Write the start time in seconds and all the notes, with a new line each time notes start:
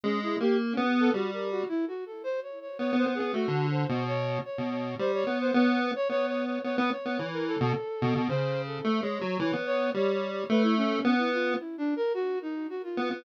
0.04 G#3 C#4
0.23 E4
0.40 A#3 G4
0.72 C#4
0.77 B3
1.00 A4
1.14 G3 F#4
1.33 A#4
1.51 F#4
1.69 E4
1.88 F#4
2.06 A4
2.24 C5
2.43 C#5
2.61 C#5
2.79 B3 C#5
2.93 B3
2.97 C5
3.06 B3
3.15 G#4
3.20 B3
3.33 A3 F#4
3.48 D3
3.71 C5
3.89 B2
4.07 C#5
4.45 C#5
4.58 B2
4.71 C#5
4.99 G3 C5
5.14 C#5
5.27 B3
5.41 C5
5.54 B3 C#5
5.96 C#5
6.09 B3 C#5
6.27 C#5
6.46 C#5
6.64 B3 C#5
6.77 B3 B4
6.91 C#5
7.06 B3
7.19 E3
7.33 A#4
7.47 A4
7.60 B2
8.02 B2
8.16 B2
8.29 C#3 C5
8.66 A4
8.84 A3
9.02 G#3 C#5
9.21 F#3
9.39 E3 C#5
9.53 B3
9.66 C#5
9.94 G3 C#5
10.13 C#5
10.31 C#5
10.50 A3 B4
10.63 E4
10.77 C#4
11.05 B3
11.18 E4
11.33 F4
11.60 E4
11.78 D4
11.96 A#4
12.14 F#4
12.42 D#4
12.70 F#4
12.83 F4
12.97 B3
13.11 B3